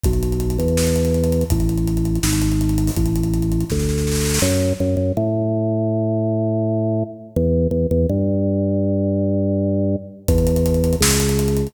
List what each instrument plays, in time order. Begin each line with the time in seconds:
0.04 drawbar organ B1, kick, closed hi-hat
0.13 closed hi-hat
0.23 closed hi-hat
0.32 closed hi-hat
0.40 closed hi-hat
0.50 closed hi-hat
0.58 drawbar organ E2, closed hi-hat
0.68 closed hi-hat
0.77 snare
0.87 closed hi-hat
0.96 closed hi-hat
1.05 closed hi-hat
1.14 closed hi-hat
1.24 closed hi-hat
1.32 closed hi-hat
1.41 closed hi-hat
1.50 drawbar organ A1, kick, closed hi-hat
1.60 closed hi-hat
1.69 closed hi-hat
1.78 closed hi-hat
1.87 closed hi-hat
1.97 closed hi-hat
2.05 closed hi-hat
2.15 closed hi-hat
2.23 drawbar organ G#1, snare
2.33 closed hi-hat
2.42 closed hi-hat
2.52 closed hi-hat
2.61 closed hi-hat
2.69 closed hi-hat
2.78 closed hi-hat
2.87 open hi-hat
2.96 drawbar organ A1, kick, closed hi-hat
3.06 closed hi-hat
3.16 closed hi-hat
3.23 closed hi-hat
3.34 closed hi-hat
3.42 closed hi-hat
3.52 closed hi-hat
3.61 closed hi-hat
3.70 drawbar organ D2, kick, snare
3.79 snare
3.89 snare
3.98 snare
4.07 snare
4.12 snare
4.15 snare
4.21 snare
4.25 snare
4.29 snare
4.34 snare
4.39 drawbar organ F#2, snare
4.80 drawbar organ F#2
4.97 drawbar organ F#2
5.17 drawbar organ A2
7.36 drawbar organ E2
7.71 drawbar organ E2
7.91 drawbar organ E2
8.09 drawbar organ G2
10.28 drawbar organ E2, kick, closed hi-hat
10.38 closed hi-hat
10.47 closed hi-hat
10.56 closed hi-hat
10.66 closed hi-hat
10.74 closed hi-hat
10.84 closed hi-hat
10.93 closed hi-hat
11.01 drawbar organ C#2, snare
11.11 closed hi-hat
11.20 closed hi-hat
11.29 closed hi-hat
11.39 closed hi-hat
11.48 closed hi-hat
11.57 closed hi-hat
11.67 closed hi-hat